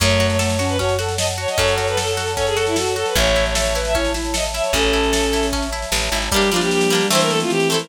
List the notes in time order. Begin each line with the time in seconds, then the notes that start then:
0.00 F#2 A3 C#4 C#5 F#5 A5, kick, snare, crash
0.10 snare
0.20 F#4, snare
0.29 C#5, snare
0.39 A3 A4 C#5, snare
0.49 snare
0.59 C#4 F#4, snare
0.69 B4, snare
0.78 C#4 F#4 C#5, kick, snare
0.89 snare
0.99 F#4 A4, snare
1.08 snare
1.17 A4 D#5, snare
1.28 snare
1.38 F#4 C#5
1.48 D#5, snare
1.58 F#2 C#4 A4 C#5, kick, snare
1.68 snare
1.78 F#4 C#5, snare
1.87 B4, snare
1.97 A4, snare
2.07 snare
2.17 F#4, snare
2.27 snare
2.37 C#4 A4 C#5, kick, snare
2.47 G#4, snare
2.56 F#4 A4, snare
2.67 E4, snare
2.76 F#4 A4, snare
2.86 snare
2.96 F#4 A4, snare
3.06 B4, snare
3.15 A1 C#4 C#5 E5 A5, kick, snare
3.26 snare
3.35 E4, snare
3.45 C#5, snare
3.55 A4 C#5 E5, snare
3.65 snare
3.75 E4 B4, snare
3.85 E5, snare
3.95 C#4 E4 C#5, kick, snare
4.05 snare
4.14 E4, snare
4.24 snare
4.34 A4 D#5, snare
4.44 snare
4.54 E4 E5, snare
4.63 C#5, snare
4.73 A1 C#4 A4, kick, snare
4.83 snare
4.93 E4, snare
5.03 snare
5.13 A4, snare
5.23 snare
5.33 E4, snare
5.43 snare
5.53 C#4, kick, snare
5.62 snare
5.72 E4, snare
5.82 snare
5.92 A1 A4, snare
6.02 snare
6.12 G#1 E4, snare
6.22 snare
6.31 G3 A#3 D4 G4, kick, snare
6.36 D4
6.42 snare
6.51 F3 G3 A#3 F4, snare
6.56 D4
6.61 G4, snare
6.70 G4, snare
6.81 snare
6.90 G3 A#3, snare
6.95 D4
7.01 snare
7.10 E3 A3 C4 E4 C5, snare
7.15 E4
7.20 A#4, snare
7.29 A4, snare
7.40 F4, snare
7.50 E3 G4, snare
7.60 snare
7.69 A3 C4 A4, snare
7.74 E4
7.80 A#4, snare